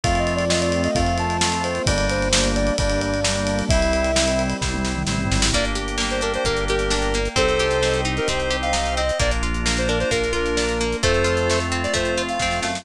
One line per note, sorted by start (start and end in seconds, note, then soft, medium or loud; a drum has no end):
0.04 0.88 F2 medium
0.04 1.85 A3 medium
0.04 0.45 A3 loud
0.04 1.85 C4 medium
0.04 0.45 C4 loud
0.04 1.85 F4 loud
0.04 0.45 F4 loud
0.04 0.19 F5 medium
0.04 kick medium
0.04 ride medium
0.15 0.33 D#5 medium
0.15 ride medium
0.27 ride medium
0.35 0.50 D5 medium
0.35 ride medium
0.50 0.91 A3 medium
0.50 0.91 C4 medium
0.50 0.91 F4 medium
0.50 0.60 D#5 medium
0.50 snare loud
0.61 0.81 D5 medium
0.61 ride medium
0.72 ride medium
0.84 0.95 D#5 medium
0.84 ride medium
0.95 1.80 F2 medium
0.95 1.37 A3 medium
0.95 1.37 C4 medium
0.95 1.37 F4 medium
0.95 1.16 F5 medium
0.95 kick medium
0.95 ride medium
1.06 ride medium
1.18 1.63 A5 medium
1.18 ride medium
1.30 ride medium
1.41 1.82 A3 medium
1.41 1.82 C4 loud
1.41 1.82 F4 medium
1.41 snare loud
1.52 ride medium
1.64 1.85 C5 medium
1.64 ride medium
1.75 ride medium
1.86 2.71 G1 loud
1.86 3.68 G3 medium
1.86 2.29 G3 loud
1.86 3.68 A#3 loud
1.86 2.29 A#3 loud
1.86 3.68 D4 loud
1.86 2.29 D4 loud
1.86 2.06 D5 medium
1.86 kick medium
1.86 ride loud
1.98 ride medium
2.10 2.48 C5 medium
2.10 ride medium
2.22 ride medium
2.33 2.74 G3 medium
2.33 2.74 A#3 medium
2.33 2.74 D4 medium
2.33 snare loud
2.44 ride medium
2.55 2.76 D5 medium
2.55 ride medium
2.67 ride medium
2.78 3.63 G1 medium
2.78 3.20 G3 loud
2.78 3.20 A#3 medium
2.78 3.20 D4 loud
2.78 3.00 D5 medium
2.78 kick medium
2.78 ride medium
2.90 ride medium
3.01 3.59 D5 medium
3.01 ride medium
3.14 ride medium
3.24 3.65 G3 medium
3.24 3.65 A#3 medium
3.24 3.65 D4 medium
3.24 snare loud
3.36 ride medium
3.47 ride medium
3.59 ride medium
3.69 4.54 C2 medium
3.69 5.52 G3 loud
3.69 4.12 G3 loud
3.69 5.52 C4 medium
3.69 4.12 C4 loud
3.69 5.52 E4 medium
3.69 4.12 E4 loud
3.69 4.42 E5 medium
3.69 kick loud
3.69 ride loud
3.82 ride medium
3.93 ride medium
4.04 ride medium
4.16 4.57 G3 medium
4.16 4.57 C4 medium
4.16 4.57 E4 medium
4.16 snare loud
4.28 ride medium
4.39 ride medium
4.50 ride medium
4.61 5.05 C2 medium
4.61 5.03 G3 medium
4.61 5.03 C4 medium
4.61 5.03 E4 medium
4.61 kick medium
4.61 snare medium
4.74 high tom medium
4.85 snare medium
4.96 mid tom medium
5.07 5.28 A1 medium
5.07 5.49 G3 medium
5.07 5.49 C4 loud
5.07 5.49 E4 medium
5.07 snare medium
5.18 floor tom medium
5.31 5.52 G#1 medium
5.31 snare medium
5.42 snare loud
5.53 6.38 G1 medium
5.53 7.18 A#3 medium
5.53 5.77 A#3 medium
5.53 7.18 D4 medium
5.53 7.18 G4 medium
5.53 7.35 A#4 medium
5.53 7.35 D5 medium
5.53 5.65 D5 medium
5.53 7.35 G5 medium
5.53 kick medium
5.53 closed hi-hat medium
5.65 closed hi-hat medium
5.75 5.98 G4 medium
5.75 closed hi-hat medium
5.88 closed hi-hat medium
5.98 6.21 A#3 medium
5.98 snare medium
6.10 6.22 C5 medium
6.10 closed hi-hat medium
6.21 6.45 D4 medium
6.21 6.33 A#4 medium
6.21 closed hi-hat medium
6.34 6.45 C5 medium
6.34 closed hi-hat medium
6.45 7.29 G1 medium
6.45 6.69 A#3 medium
6.45 6.65 A#4 medium
6.45 kick medium
6.45 closed hi-hat medium
6.57 closed hi-hat medium
6.68 6.93 G4 medium
6.68 7.29 A#4 medium
6.68 closed hi-hat medium
6.79 closed hi-hat medium
6.90 7.14 D4 medium
6.90 snare medium
7.02 closed hi-hat medium
7.14 7.36 A#3 medium
7.14 closed hi-hat medium
7.25 closed hi-hat medium
7.36 8.20 C2 medium
7.36 7.59 C4 medium
7.36 9.01 C4 medium
7.36 9.01 D#4 medium
7.36 9.01 G4 medium
7.36 8.01 A4 medium
7.36 8.01 C5 medium
7.36 9.18 C5 medium
7.36 9.18 D#5 medium
7.36 9.18 G5 medium
7.36 kick medium
7.36 closed hi-hat medium
7.48 closed hi-hat medium
7.59 7.83 G4 medium
7.59 closed hi-hat medium
7.71 closed hi-hat medium
7.83 8.05 C4 medium
7.83 snare medium
7.94 closed hi-hat medium
8.05 8.28 D#4 medium
8.05 closed hi-hat medium
8.17 8.28 A#4 medium
8.17 closed hi-hat medium
8.27 9.12 C2 medium
8.27 8.52 C4 medium
8.27 8.57 C5 medium
8.27 kick medium
8.27 closed hi-hat medium
8.40 closed hi-hat soft
8.51 8.73 G4 medium
8.51 closed hi-hat medium
8.62 8.95 F5 medium
8.62 closed hi-hat medium
8.73 8.96 D#4 medium
8.73 snare medium
8.86 closed hi-hat medium
8.97 9.19 C4 medium
8.97 9.19 D#5 medium
8.97 closed hi-hat medium
9.09 closed hi-hat medium
9.19 10.05 A#1 medium
9.19 9.42 A#3 medium
9.19 10.84 A#3 medium
9.19 11.01 A#3 medium
9.19 10.84 D4 medium
9.19 11.01 D4 medium
9.19 10.84 F4 medium
9.19 11.01 F4 medium
9.19 9.31 D5 medium
9.19 kick medium
9.19 closed hi-hat medium
9.31 closed hi-hat medium
9.43 9.66 F4 medium
9.43 closed hi-hat medium
9.54 closed hi-hat medium
9.66 9.89 A#3 medium
9.66 snare medium
9.77 9.89 C5 medium
9.77 closed hi-hat medium
9.88 10.12 D4 medium
9.88 9.99 A#4 medium
9.88 closed hi-hat medium
10.00 10.11 C5 medium
10.00 closed hi-hat medium
10.11 10.95 A#1 medium
10.11 10.34 A#3 medium
10.11 10.33 A#4 medium
10.11 kick medium
10.11 closed hi-hat medium
10.24 closed hi-hat medium
10.33 10.56 F4 medium
10.33 10.97 A#4 medium
10.33 closed hi-hat medium
10.46 closed hi-hat medium
10.57 10.80 D4 medium
10.57 snare medium
10.69 closed hi-hat medium
10.80 11.02 A#3 medium
10.80 closed hi-hat medium
10.92 closed hi-hat medium
11.03 11.87 F2 medium
11.03 12.68 A3 medium
11.03 12.85 A3 medium
11.03 11.26 A3 loud
11.03 12.68 C4 medium
11.03 12.85 C4 medium
11.03 12.68 F4 medium
11.03 12.85 F4 medium
11.03 11.59 A4 medium
11.03 11.59 C5 medium
11.03 kick medium
11.03 closed hi-hat medium
11.14 closed hi-hat medium
11.24 11.47 F4 medium
11.24 closed hi-hat medium
11.37 closed hi-hat medium
11.50 11.74 A3 medium
11.50 snare medium
11.60 closed hi-hat medium
11.72 11.95 C4 medium
11.72 closed hi-hat medium
11.83 11.94 D5 medium
11.83 closed hi-hat medium
11.94 12.38 F2 medium
11.94 12.17 A3 medium
11.94 12.22 C5 medium
11.94 kick medium
11.94 closed hi-hat medium
12.05 closed hi-hat medium
12.17 12.41 F4 medium
12.17 closed hi-hat medium
12.29 12.60 F5 medium
12.29 closed hi-hat medium
12.40 12.61 F2 medium
12.40 12.65 C4 medium
12.40 kick medium
12.40 snare medium
12.51 snare medium
12.62 12.84 F#2 medium
12.62 12.85 A3 medium
12.62 12.81 F5 medium
12.62 snare medium
12.75 snare medium